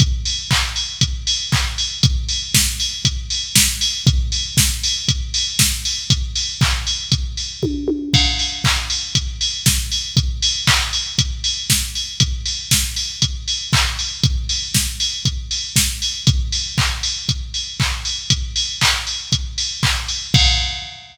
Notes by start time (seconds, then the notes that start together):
0.00 kick, closed hi-hat
0.25 open hi-hat
0.51 kick, clap
0.76 open hi-hat
1.01 kick, closed hi-hat
1.27 open hi-hat
1.52 kick, clap
1.78 open hi-hat
2.03 kick, closed hi-hat
2.29 open hi-hat
2.54 kick, snare
2.80 open hi-hat
3.05 kick, closed hi-hat
3.30 open hi-hat
3.56 kick, snare
3.81 open hi-hat
4.07 kick, closed hi-hat
4.32 open hi-hat
4.57 kick, snare
4.83 open hi-hat
5.08 kick, closed hi-hat
5.34 open hi-hat
5.59 kick, snare
5.85 open hi-hat
6.10 kick, closed hi-hat
6.35 open hi-hat
6.61 kick, clap
6.87 open hi-hat
7.12 kick, closed hi-hat
7.37 open hi-hat
7.63 kick, high tom
7.88 high tom
8.14 kick, crash
8.39 open hi-hat
8.64 kick, clap
8.90 open hi-hat
9.15 kick, closed hi-hat
9.41 open hi-hat
9.66 kick, snare
9.92 open hi-hat
10.17 kick, closed hi-hat
10.42 open hi-hat
10.67 kick, clap
10.93 open hi-hat
11.18 kick, closed hi-hat
11.44 open hi-hat
11.70 kick, snare
11.95 open hi-hat
12.20 kick, closed hi-hat
12.46 open hi-hat
12.71 kick, snare
12.96 open hi-hat
13.22 kick, closed hi-hat
13.48 open hi-hat
13.73 kick, clap
13.99 open hi-hat
14.23 kick, closed hi-hat
14.49 open hi-hat
14.74 kick, snare
15.00 open hi-hat
15.25 kick, closed hi-hat
15.51 open hi-hat
15.76 kick, snare
16.02 open hi-hat
16.27 kick, closed hi-hat
16.52 open hi-hat
16.78 kick, clap
17.03 open hi-hat
17.29 kick, closed hi-hat
17.54 open hi-hat
17.80 kick, clap
18.05 open hi-hat
18.30 kick, closed hi-hat
18.56 open hi-hat
18.81 kick, clap
19.07 open hi-hat
19.32 kick, closed hi-hat
19.58 open hi-hat
19.83 kick, clap
20.08 open hi-hat
20.34 kick, crash